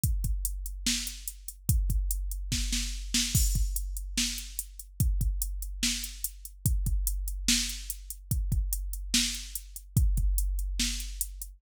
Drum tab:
CC |--------|--------|x-------|--------|
HH |xxxx-xxx|xxxx----|-xxx-xxx|xxxx-xxx|
SD |----o---|----oo-o|----o---|----o---|
BD |oo------|oo--o---|oo------|oo------|

CC |--------|--------|--------|
HH |xxxx-xxx|xxxx-xxx|xxxx-xxx|
SD |----o---|----o---|----o---|
BD |oo------|oo------|oo------|